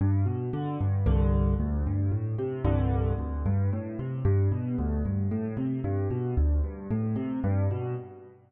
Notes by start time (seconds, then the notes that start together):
0.01 G2
0.26 B2
0.53 D3
0.81 G2
1.06 C2 G2 D3
1.60 D2
1.87 G2
2.12 A2
2.38 C3
2.64 C2 G2 D3
3.19 D2
3.46 G2
3.73 A2
3.99 C3
4.25 G2
4.52 B2
4.78 D2
5.05 G2
5.31 A2
5.57 C3
5.84 G2
6.10 B2
6.37 D2
6.64 G2
6.90 A2
7.16 C3
7.44 G2
7.71 B2